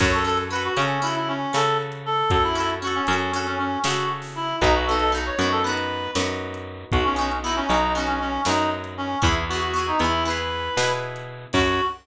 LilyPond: <<
  \new Staff \with { instrumentName = "Clarinet" } { \time 9/8 \key fis \dorian \tempo 4. = 78 cis''16 a'16 a'16 r16 b'16 fis'16 cis'8 e'16 e'16 cis'8 a'8 r8 a'8 | a'16 e'16 e'16 r16 fis'16 cis'16 cis'8 cis'16 cis'16 cis'8 fis'8 r8 e'8 | dis'16 fis'16 a'16 a'16 r16 cis''8 a'16 b'4 r4. | fis'16 cis'16 cis'16 r16 e'16 cis'16 dis'8 cis'16 cis'16 cis'8 dis'8 r8 cis'8 |
e'16 r16 fis'16 fis'16 fis'16 dis'16 e'8 b'4. r4 | fis'4. r2. | }
  \new Staff \with { instrumentName = "Acoustic Guitar (steel)" } { \time 9/8 \key fis \dorian <cis' fis' a'>8 <cis' fis' a'>8 <cis' fis' a'>8 <cis' fis' a'>8 <cis' fis' a'>4 <cis' fis' a'>4.~ | <cis' fis' a'>8 <cis' fis' a'>8 <cis' fis' a'>8 <cis' fis' a'>8 <cis' fis' a'>4 <cis' fis' a'>4. | <b dis' fis'>8 <b dis' fis'>8 <b dis' fis'>8 <b dis' fis'>8 <b dis' fis'>4 <b dis' fis'>4.~ | <b dis' fis'>8 <b dis' fis'>8 <b dis' fis'>8 <b dis' fis'>8 <b dis' fis'>4 <b dis' fis'>4. |
<b e' gis'>8 <b e' gis'>8 <b e' gis'>8 <b e' gis'>8 <b e' gis'>4 <b e' gis'>4. | <cis' fis' a'>4. r2. | }
  \new Staff \with { instrumentName = "Electric Bass (finger)" } { \clef bass \time 9/8 \key fis \dorian fis,4. cis4. cis4. | fis,4. fis,4. cis4. | b,,4. fis,4. fis,4. | b,,4. b,,4. fis,4. |
e,4. e,4. b,4. | fis,4. r2. | }
  \new DrumStaff \with { instrumentName = "Drums" } \drummode { \time 9/8 <cymc bd>8. hh8. hh8. hh8. sn8. hh8. | <hh bd>8. hh8. hh8. hh8. sn8. hho8. | <hh bd>8. hh8. hh8. hh8. sn8. hh8. | <hh bd>8. hh8. hh8. hh8. sn8. hh8. |
<hh bd>8. hh8. hh8. hh8. sn8. hh8. | <cymc bd>4. r4. r4. | }
>>